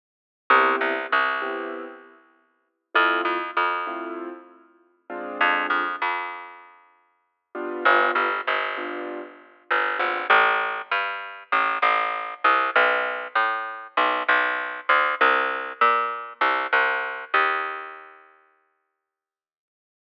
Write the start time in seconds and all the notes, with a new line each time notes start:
0.50 C2 B3 C4 E4 G4
0.81 C2
1.12 C2
1.42 B3 C4 E4 G4
2.95 F2 A3 C4 E4 F4
3.25 F2
3.57 F2
3.87 A3 C4 E4 F4
5.10 G#3 C4 D4 F4
5.41 F2
5.70 F2
6.02 F2
7.55 G3 B3 D4 F4
7.85 G1
8.15 G1
8.47 G1
8.77 G3 B3 D4 F4
9.71 G1
9.99 G#1 G3 B3 D4 F4
10.30 A1
10.91 G2
11.52 A1
11.82 A1
12.44 C2
12.76 B1
13.35 A2
13.97 B1
14.28 B1
14.89 D2
15.21 C2
15.81 A#2
16.41 C2
16.73 C2
17.34 D#2